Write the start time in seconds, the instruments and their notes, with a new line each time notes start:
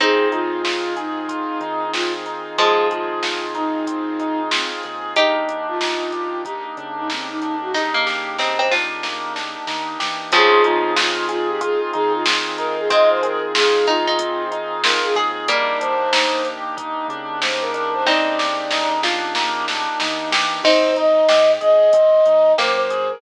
0.00 synth bass 1 F2, pizzicato strings C4 D#4, pad 2 (warm) C4 D#4 F4 G#4, acoustic grand piano C4, flute G#4, kick, closed hi-hat
0.32 synth bass 1 F2, acoustic grand piano D#4, flute F4, closed hi-hat
0.65 acoustic grand piano F4, snare
0.97 flute D#4, acoustic grand piano G#4, closed hi-hat
1.29 acoustic grand piano F4, kick, closed hi-hat
1.60 synth bass 1 D#3, acoustic grand piano D#4, closed hi-hat
1.93 acoustic grand piano C4, flute F4, snare
2.26 acoustic grand piano D#4, closed hi-hat
2.58 pizzicato strings F3 G#3, acoustic grand piano F4, flute G#4, kick, closed hi-hat
2.90 flute F4, acoustic grand piano G#4, closed hi-hat
3.23 acoustic grand piano F4, snare
3.55 flute D#4, acoustic grand piano D#4, closed hi-hat
3.87 acoustic grand piano C4, kick, closed hi-hat
4.19 acoustic grand piano D#4, closed hi-hat
4.51 flute C4, acoustic grand piano F4, snare
4.83 synth bass 1 D#2, acoustic grand piano G#4, closed hi-hat
5.16 acoustic grand piano A#3, pad 2 (warm) A#3 D4 D#4 G4, pizzicato strings D#4 G4, flute G4, kick, closed hi-hat
5.48 synth bass 1 D#2, acoustic grand piano D4, closed hi-hat
5.68 flute F4
5.81 acoustic grand piano D#4, snare
6.12 acoustic grand piano G4, closed hi-hat
6.45 acoustic grand piano D#4, flute G4, kick, closed hi-hat
6.77 synth bass 1 C#3, acoustic grand piano D4, closed hi-hat
6.97 flute D#4
7.10 acoustic grand piano A#3, flute C4, snare
7.29 flute D#4
7.42 acoustic grand piano D4, closed hi-hat
7.62 flute F#4
7.74 pizzicato strings D#4, acoustic grand piano D#4, flute G4, kick, snare
7.94 pizzicato strings A#3
8.07 acoustic grand piano G4, snare
8.39 pizzicato strings C4, acoustic grand piano D#4, snare
8.59 pizzicato strings C4
8.71 acoustic grand piano D4, pizzicato strings F4, snare
9.03 acoustic grand piano A#3, snare
9.35 acoustic grand piano D4, snare
9.67 synth bass 1 D#3, acoustic grand piano D#4, snare
10.00 synth bass 1 E3, acoustic grand piano G4, snare
10.32 synth bass 1 F2, pizzicato strings C#3 F3, pad 2 (warm) C4 D#4 F4 G#4, acoustic grand piano C4, flute G#4, kick, closed hi-hat
10.64 synth bass 1 F2, acoustic grand piano D#4, flute F4, closed hi-hat
10.96 acoustic grand piano F4, flute F4, snare
11.29 flute F4, acoustic grand piano G#4, closed hi-hat
11.49 flute G4
11.61 acoustic grand piano F4, flute G#4, kick, closed hi-hat
11.93 synth bass 1 D#3, acoustic grand piano D#4, flute G#4, closed hi-hat
12.13 flute F4
12.26 acoustic grand piano C4, snare
12.58 acoustic grand piano D#4, flute A#4, closed hi-hat
12.78 flute G#4
12.90 pizzicato strings G#3 C4, acoustic grand piano F4, flute D#5, kick, closed hi-hat
13.10 flute C5
13.23 acoustic grand piano G#4, flute A#4, closed hi-hat
13.55 acoustic grand piano F4, flute G#4, snare
13.87 pizzicato strings D#4, acoustic grand piano D#4, flute F4, closed hi-hat
14.07 pizzicato strings D#4
14.19 acoustic grand piano C4, kick, closed hi-hat
14.51 acoustic grand piano D#4, closed hi-hat
14.84 acoustic grand piano F4, flute A#4, snare
15.04 flute G#4
15.15 synth bass 1 D#2, acoustic grand piano G#4, pizzicato strings G#4, closed hi-hat
15.48 pizzicato strings G3 A#3, pad 2 (warm) A#3 D4 D#4 G4, acoustic grand piano A#3, flute D5, kick, closed hi-hat
15.81 synth bass 1 D#2, acoustic grand piano D4, flute C5, closed hi-hat
16.13 acoustic grand piano D#4, snare
16.45 acoustic grand piano G4, closed hi-hat
16.77 acoustic grand piano D#4, kick, closed hi-hat
17.08 synth bass 1 C#3, acoustic grand piano D4, closed hi-hat
17.42 acoustic grand piano A#3, flute C5, snare
17.62 flute A#4
17.74 acoustic grand piano D4, closed hi-hat
17.94 flute C5
18.06 pizzicato strings C4 D#4, acoustic grand piano D#4, flute D5, kick, snare
18.39 acoustic grand piano G4, snare
18.71 acoustic grand piano D#4, snare
19.03 acoustic grand piano D4, pizzicato strings F4, snare
19.35 acoustic grand piano A#3, snare
19.68 acoustic grand piano D4, snare
20.00 synth bass 1 D#3, acoustic grand piano D#4, snare
20.31 synth bass 1 E3, acoustic grand piano G4, snare
20.64 synth bass 1 G#1, acoustic grand piano C4, pizzicato strings C4 D#4, flute C5, kick, crash
20.96 acoustic grand piano D#4, flute D#5, closed hi-hat
21.29 synth bass 1 G#2, acoustic grand piano G4, snare
21.61 synth bass 1 G#1, acoustic grand piano G#4, flute D#5, closed hi-hat
21.93 synth bass 1 G#1, acoustic grand piano C4, kick, closed hi-hat
22.26 synth bass 1 D#2, acoustic grand piano D#4, closed hi-hat
22.58 synth bass 1 F#2, pizzicato strings A#3, acoustic grand piano G4, flute C5, snare
22.78 flute C5
22.90 acoustic grand piano G#4, closed hi-hat
23.10 flute A#4